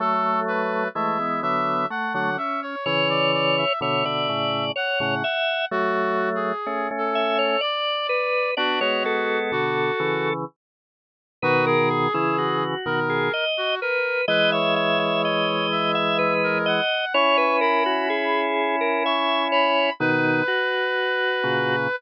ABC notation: X:1
M:3/4
L:1/16
Q:1/4=63
K:A
V:1 name="Brass Section"
A2 B2 e2 e2 f f e c | c d d e e4 f f3 | (3F4 G4 A4 d4 | F F3 F4 z4 |
[K:B] F G5 A3 F A2 | B c5 e3 A f2 | c'2 b4 z2 c'2 b2 | B10 z2 |]
V:2 name="Drawbar Organ"
A,4 A, B,3 A,2 C2 | c4 c d3 c2 e2 | z6 e c d2 B2 | d c A6 z4 |
[K:B] B A G E F3 G d2 B2 | d e e e d3 e B2 d2 | c B A F G3 A e2 c2 | D2 F6 z4 |]
V:3 name="Drawbar Organ"
[F,A,]4 [E,G,] [E,G,] [D,F,]2 z [D,F,] z2 | [C,E,]4 [B,,D,] [B,,D,] [A,,C,]2 z [A,,C,] z2 | [F,A,]4 [A,C] [A,C]3 z4 | [B,D] [G,B,] [G,B,]2 [B,,D,]2 [C,E,]2 z4 |
[K:B] [B,,D,]3 [C,E,]3 [B,,D,]2 z4 | [E,G,]12 | [CE]12 | [B,,D,]2 z4 [A,,C,]2 z4 |]